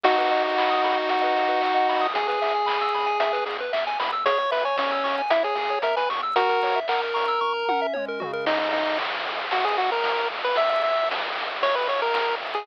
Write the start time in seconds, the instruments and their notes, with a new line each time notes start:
0.04 synth bass 1 B1, lead 1 (square) D#4 F#4, kick, crash
0.18 lead 1 (square) B4, closed hi-hat
0.30 synth bass 1 B1, lead 1 (square) D#5, open hi-hat
0.43 lead 1 (square) F#5, closed hi-hat
0.57 synth bass 1 B1, lead 1 (square) B5, kick, clap
0.70 lead 1 (square) D#6, closed hi-hat
0.83 synth bass 1 B1, lead 1 (square) B5, open hi-hat
0.97 lead 1 (square) F#5, closed hi-hat
1.08 synth bass 1 B1, lead 1 (square) D#5, kick, closed hi-hat
1.22 lead 1 (square) B4, closed hi-hat
1.35 synth bass 1 B1, lead 1 (square) F#4, open hi-hat
1.49 lead 1 (square) B4, closed hi-hat
1.61 synth bass 1 B1, lead 1 (square) D#5, kick, clap
1.76 lead 1 (square) F#5, closed hi-hat
1.89 synth bass 1 B1, lead 1 (square) B5, open hi-hat
2.01 lead 1 (square) D#6, open hi-hat
2.14 synth bass 1 E2, lead 1 (square) G#4, kick, closed hi-hat
2.28 lead 1 (square) G#4 B4, closed hi-hat
2.42 synth bass 1 E2, lead 1 (square) E5, open hi-hat
2.54 lead 1 (square) G#5, closed hi-hat
2.66 synth bass 1 E2, lead 1 (square) B5, kick, clap
2.80 lead 1 (square) E6, closed hi-hat
2.94 synth bass 1 E2, lead 1 (square) B5, open hi-hat
3.06 lead 1 (square) G#5, closed hi-hat
3.20 synth bass 1 E2, lead 1 (square) E5, closed hi-hat
3.33 lead 1 (square) B4, closed hi-hat
3.46 synth bass 1 E2, lead 1 (square) G#4, open hi-hat
3.58 lead 1 (square) B4, closed hi-hat
3.73 synth bass 1 E2, lead 1 (square) E5, kick, clap
3.87 lead 1 (square) G#5, closed hi-hat
4.00 synth bass 1 E2, lead 1 (square) B5, open hi-hat
4.12 lead 1 (square) E6, closed hi-hat
4.25 synth bass 1 E2, lead 1 (square) G#4 C#5, kick, closed hi-hat
4.38 lead 1 (square) C#5, closed hi-hat
4.51 synth bass 1 E2, lead 1 (square) B4 E5, open hi-hat
4.64 lead 1 (square) C#5 G#5, closed hi-hat
4.76 synth bass 1 E2, lead 1 (square) C#4 C#6, kick, snare
4.91 lead 1 (square) E6, closed hi-hat
5.04 synth bass 1 E2, lead 1 (square) C#6, open hi-hat
5.18 lead 1 (square) G#5, closed hi-hat
5.30 synth bass 1 E2, lead 1 (square) E4 E5, kick, closed hi-hat
5.43 lead 1 (square) G#4 C#5, closed hi-hat
5.55 synth bass 1 E2, lead 1 (square) G#4, open hi-hat
5.70 lead 1 (square) C#5, closed hi-hat
5.82 synth bass 1 E2, lead 1 (square) A#4 E5, kick, closed hi-hat
5.96 lead 1 (square) B4 G#5, closed hi-hat
6.10 synth bass 1 E2, lead 1 (square) C#6, open hi-hat
6.22 lead 1 (square) E6, closed hi-hat
6.36 synth bass 1 F#2, lead 1 (square) F#4 A#4, kick, closed hi-hat
6.49 lead 1 (square) A#4, closed hi-hat
6.62 synth bass 1 F#2, lead 1 (square) C#5, open hi-hat
6.76 lead 1 (square) E5, closed hi-hat
6.88 synth bass 1 F#2, lead 1 (square) A#4 F#5, kick, clap
7.02 lead 1 (square) A#5, closed hi-hat
7.14 synth bass 1 F#2, lead 1 (square) C#6, open hi-hat
7.28 lead 1 (square) E6, closed hi-hat
7.41 synth bass 1 F#2, lead 1 (square) C#6, kick
7.54 lead 1 (square) A#5
7.68 synth bass 1 F#2, lead 1 (square) F#5, high tom
7.82 lead 1 (square) E5
7.93 synth bass 1 F#2, lead 1 (square) C#5, mid tom
8.08 lead 1 (square) A#4
8.20 synth bass 1 F#2, lead 1 (square) F#4, floor tom
8.33 lead 1 (square) A#4
8.45 synth bass 1 G#1, lead 1 (square) D#4, kick, crash
8.59 lead 1 (square) D#4
8.72 synth bass 1 G#1, lead 1 (square) D#4, ride
8.98 synth bass 1 G#1, kick, clap, ride
9.26 synth bass 1 G#1, ride
9.51 synth bass 1 G#1, lead 1 (square) F#4, kick, ride
9.64 lead 1 (square) G#4
9.77 synth bass 1 G#1, lead 1 (square) F#4, snare, ride
9.92 lead 1 (square) A#4
10.04 synth bass 1 G#1, kick, snare
10.30 synth bass 1 G#1, ride
10.44 lead 1 (square) B4
10.55 synth bass 1 A#1, lead 1 (square) E5, kick, ride
10.70 lead 1 (square) E5
10.83 synth bass 1 A#1, lead 1 (square) E5, ride
11.10 synth bass 1 A#1, kick, snare
11.35 synth bass 1 A#1, ride
11.61 synth bass 1 A#1, lead 1 (square) C#5, kick, ride
11.75 lead 1 (square) B4
11.88 synth bass 1 A#1, lead 1 (square) C#5, snare, ride
12.02 lead 1 (square) A#4
12.14 synth bass 1 A#1, kick, snare
12.41 synth bass 1 A#1, ride
12.55 lead 1 (square) G#4